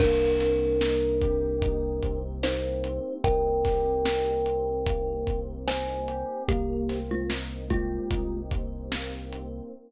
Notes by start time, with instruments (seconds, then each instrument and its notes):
0.00 synth bass 1 C2, electric piano 1 A#3, kalimba D4 A#4, kick, crash
0.40 electric piano 1 C4, snare, closed hi-hat
0.81 electric piano 1 D#4, snare
1.21 electric piano 1 G4, kick, closed hi-hat
1.62 electric piano 1 D#4, kick, closed hi-hat
2.03 electric piano 1 C4, kick, closed hi-hat
2.43 electric piano 1 A#3, kalimba D#4 C5, snare
2.84 electric piano 1 C4, closed hi-hat
3.24 synth bass 1 C2, electric piano 1 D#4, kalimba A#4 G5, kick, closed hi-hat
3.65 electric piano 1 G4, kick, snare, closed hi-hat
4.05 electric piano 1 D#4, snare
4.46 electric piano 1 C4, closed hi-hat
4.86 electric piano 1 A#3, kick, closed hi-hat
5.27 electric piano 1 C4, kick, closed hi-hat
5.67 electric piano 1 D#4, kalimba C5 G#5, snare
6.08 electric piano 1 G4, closed hi-hat
6.48 synth bass 1 C2, kalimba A#3 G4, electric piano 1 A#3, kick, closed hi-hat
6.89 electric piano 1 C4, snare, closed hi-hat
7.11 kalimba G#3 F4
7.30 electric piano 1 D#4, snare
7.70 kalimba G#3 F4, electric piano 1 G4, kick, closed hi-hat
8.11 synth bass 1 C2, electric piano 1 D#4, kick, closed hi-hat
8.51 electric piano 1 C4, kick, closed hi-hat
8.92 electric piano 1 A#3, snare
9.33 electric piano 1 C4, closed hi-hat